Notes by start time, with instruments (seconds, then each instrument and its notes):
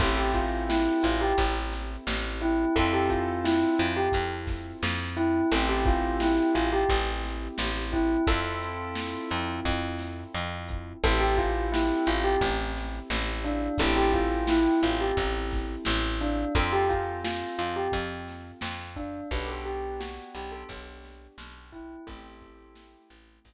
0.00 electric bass (finger) A1, acoustic grand piano C4 E4 G4 A4, tubular bells A4, kick, crash
0.17 tubular bells G4
0.34 tubular bells F4, kick, closed hi-hat
0.69 tubular bells E4, snare
1.02 electric bass (finger) A1, tubular bells F4, closed hi-hat
1.21 tubular bells G4
1.38 electric bass (finger) A1, kick, closed hi-hat
1.72 snare, closed hi-hat
2.07 electric bass (finger) A1, snare
2.41 tubular bells E4, closed hi-hat
2.76 electric bass (finger) F2, acoustic grand piano C4 E4 F4 A4, tubular bells A4, kick, closed hi-hat
2.93 tubular bells G4
3.10 tubular bells F4, kick, closed hi-hat
3.44 tubular bells E4, snare
3.79 electric bass (finger) F2, tubular bells F4, closed hi-hat
3.97 tubular bells G4
4.12 electric bass (finger) F2, kick, closed hi-hat
4.47 kick, snare, closed hi-hat
4.83 electric bass (finger) F2, snare
5.17 tubular bells E4, closed hi-hat
5.52 electric bass (finger) A1, acoustic grand piano C4 E4 G4 A4, tubular bells A4, closed hi-hat
5.69 tubular bells G4
5.85 tubular bells F4, kick, closed hi-hat
6.20 tubular bells E4, snare
6.55 electric bass (finger) A1, tubular bells F4, closed hi-hat
6.73 tubular bells G4
6.89 electric bass (finger) A1, kick, closed hi-hat
7.23 snare, closed hi-hat
7.58 electric bass (finger) A1, snare
7.93 tubular bells E4, kick, closed hi-hat
8.27 electric bass (finger) F2, acoustic grand piano C4 E4 F4 A4, tubular bells A4, kick, closed hi-hat
8.63 closed hi-hat
8.95 snare
9.30 electric bass (finger) F2, snare, closed hi-hat
9.65 electric bass (finger) F2, kick, closed hi-hat
9.99 snare, closed hi-hat
10.34 electric bass (finger) F2, closed hi-hat
10.68 kick, closed hi-hat
11.04 electric bass (finger) A1, acoustic grand piano C4 E4 G4 A4, tubular bells A4, kick, closed hi-hat
11.20 tubular bells G4
11.38 tubular bells F4, kick, closed hi-hat
11.72 tubular bells E4, snare
12.06 electric bass (finger) A1, tubular bells F4, closed hi-hat
12.24 tubular bells G4
12.41 electric bass (finger) A1, kick, closed hi-hat
12.77 snare, closed hi-hat
13.10 electric bass (finger) A1, snare
13.44 tubular bells D4, closed hi-hat
13.78 electric bass (finger) A1, acoustic grand piano C4 E4 G4 A4, tubular bells A4, kick, closed hi-hat
13.97 tubular bells G4
14.12 tubular bells F4, kick, closed hi-hat
14.47 tubular bells E4, snare
14.82 electric bass (finger) A1, tubular bells F4, closed hi-hat
15.01 tubular bells G4
15.17 electric bass (finger) A1, kick, closed hi-hat
15.51 kick, snare, closed hi-hat
15.85 electric bass (finger) A1, snare
16.21 tubular bells D4, closed hi-hat
16.55 electric bass (finger) F2, acoustic grand piano C4 F4 A4, tubular bells A4, kick, closed hi-hat
16.72 tubular bells G4
16.89 tubular bells F4, kick, closed hi-hat
17.24 tubular bells F4, snare
17.58 electric bass (finger) F2, tubular bells F4, closed hi-hat
17.76 tubular bells G4
17.92 electric bass (finger) F2, kick, closed hi-hat
18.28 snare, closed hi-hat
18.61 electric bass (finger) F2, snare
18.96 tubular bells D4, kick, closed hi-hat
19.31 electric bass (finger) B1, acoustic grand piano B3 D4 F#4 G4, tubular bells B4, kick, closed hi-hat
19.48 tubular bells A4
19.66 tubular bells G4, closed hi-hat
20.00 tubular bells F#4, snare
20.35 electric bass (finger) B1, tubular bells G4, closed hi-hat
20.52 tubular bells A4
20.69 electric bass (finger) B1, kick, closed hi-hat
21.03 snare, closed hi-hat
21.38 electric bass (finger) B1, snare
21.72 tubular bells E4, kick, closed hi-hat
22.07 electric bass (finger) A1, acoustic grand piano A3 C4 E4 G4, tubular bells A4, kick, closed hi-hat
22.41 kick, closed hi-hat
22.75 snare
23.10 electric bass (finger) A1, closed hi-hat
23.45 electric bass (finger) A1, kick, closed hi-hat